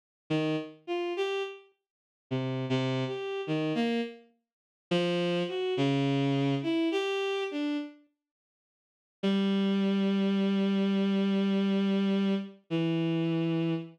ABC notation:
X:1
M:4/4
L:1/16
Q:1/4=52
K:none
V:1 name="Violin"
z _E, z F G z3 (3C,2 C,2 G2 E, _B, z2 | z F,2 _G _D,3 E =G2 =D z5 | G,12 E,4 |]